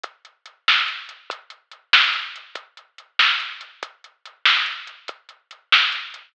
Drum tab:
HH |xxx-xx|xxx-xx|xxx-xx|xxx-xx|
SD |---o--|---o--|---o--|---o--|
BD |o-----|o-----|o-----|o-----|

HH |xxx-xx|
SD |---o--|
BD |o-----|